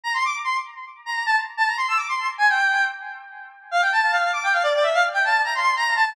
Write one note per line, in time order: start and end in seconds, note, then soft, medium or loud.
0.03 0.13 A#5 medium
0.14 0.23 C6 medium
0.25 0.35 D6 medium
0.44 0.54 C6 medium
1.06 1.23 A#5 medium
1.26 1.36 A5 medium
1.57 1.67 A5 medium
1.67 1.76 A#5 medium
1.77 1.87 C6 medium
1.88 1.98 E6 medium
1.97 2.07 D6 medium
2.09 2.27 C6 medium
2.38 2.47 G#5 medium
2.49 2.84 G5 medium
3.71 3.81 F5 medium
3.82 3.91 G5 medium
3.92 4.11 A5 medium
4.11 4.31 F5 medium
4.33 4.43 D6 medium
4.43 4.53 G5 medium
4.52 4.62 F5 medium
4.63 4.73 D5 medium
4.74 4.84 D5 medium
4.83 4.93 E5 medium
4.94 5.03 F5 medium
5.13 5.23 G5 medium
5.24 5.41 A5 medium
5.44 5.54 A#5 medium
5.55 5.74 C6 medium
5.76 5.94 A#5 loud
5.96 6.13 A5 medium